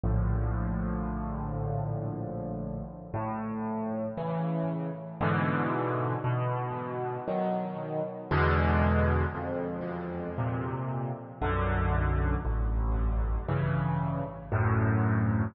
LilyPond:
\new Staff { \clef bass \time 3/4 \key d \major \tempo 4 = 58 <bes,, a, d f>2. | \key a \major a,4 <cis e>4 <gis, b, d e>4 | b,4 <dis fis>4 <e, b, d gis>4 | f,4 <bes, c>4 <b,, fis, d>4 |
a,,4 <g, cis e>4 <d, fis, a,>4 | }